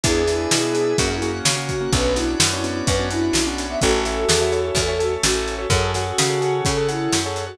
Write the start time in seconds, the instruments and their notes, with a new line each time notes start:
0.04 electric bass (finger) E2, acoustic grand piano B3 D4 E4 G#4, ocarina E4 G#4, drawbar organ B4 D5 E5 G#5, kick, closed hi-hat
0.27 acoustic grand piano B3 D4 E4 G#4, snare, closed hi-hat
0.51 electric bass (finger) B2, snare
0.63 acoustic grand piano B3 D4 E4 G#4
0.74 acoustic grand piano B3 D4 E4 G#4, closed hi-hat
0.98 electric bass (finger) F#2, acoustic grand piano A#3 C#4 F#4, drawbar organ A#4 C#5 F#5, kick, closed hi-hat
1.10 acoustic grand piano A#3 C#4 F#4
1.22 acoustic grand piano A#3 C#4 F#4, closed hi-hat
1.45 electric bass (finger) C#3, ocarina F#4, snare
1.56 acoustic grand piano A#3 C#4 F#4
1.69 kick, closed hi-hat
1.81 acoustic grand piano A#3 C#4 F#4
1.92 electric bass (finger) B1, acoustic grand piano B3 C#4 D4 F#4, ocarina B4, drawbar organ B4 C#5 D5 F#5, kick, closed hi-hat
2.15 acoustic grand piano B3 C#4 D4 F#4, ocarina E4, snare, closed hi-hat
2.40 electric bass (finger) F#2, snare
2.53 acoustic grand piano B3 C#4 D4 F#4
2.64 acoustic grand piano B3 C#4 D4 F#4, closed hi-hat
2.87 electric bass (finger) F#2, ocarina B4, kick, closed hi-hat
2.99 acoustic grand piano B3 C#4 D4 F#4
3.11 acoustic grand piano B3 C#4 D4 F#4, ocarina E4, closed hi-hat
3.33 electric bass (finger) B1, snare
3.47 acoustic grand piano B3 C#4 D4 F#4
3.58 closed hi-hat
3.70 acoustic grand piano B3 C#4 D4 F#4, ocarina E5
3.81 electric bass (finger) A1, drawbar organ C#4 E4 A4, ocarina F#4 A4, acoustic grand piano A4 C#5 E5, kick, closed hi-hat
4.05 acoustic grand piano A4 C#5 E5, snare, closed hi-hat
4.29 electric bass (finger) E2, snare
4.41 acoustic grand piano A4 C#5 E5
4.52 acoustic grand piano A4 C#5 E5, closed hi-hat
4.75 electric bass (finger) E2, drawbar organ A3 C#4 A4, kick, closed hi-hat
4.88 acoustic grand piano A4 C#5 E5
4.99 acoustic grand piano A4 C#5 E5, closed hi-hat
5.23 electric bass (finger) A1, ocarina F#4, snare
5.35 acoustic grand piano A4 C#5 E5
5.48 closed hi-hat
5.58 acoustic grand piano A4 C#5 E5
5.70 electric bass (finger) F#2, drawbar organ C#4 F#4 G#4 A4, acoustic grand piano G#4 A4 C#5 F#5, ocarina A4, kick, closed hi-hat
5.94 ocarina F#4, acoustic grand piano G#4 A4 C#5 F#5, snare, closed hi-hat
6.18 electric bass (finger) C#3, snare
6.30 acoustic grand piano G#4 A4 C#5 F#5
6.41 acoustic grand piano G#4 A4 C#5 F#5, closed hi-hat
6.65 electric bass (finger) C#3, drawbar organ C#4 F#4 A4 C#5, ocarina A4, kick, closed hi-hat
6.77 acoustic grand piano G#4 A4 C#5 F#5
6.88 ocarina E4, acoustic grand piano G#4 A4 C#5 F#5, closed hi-hat
7.13 electric bass (finger) F#2, snare
7.26 acoustic grand piano G#4 A4 C#5 F#5
7.36 closed hi-hat
7.47 ocarina F#4, acoustic grand piano G#4 A4 C#5 F#5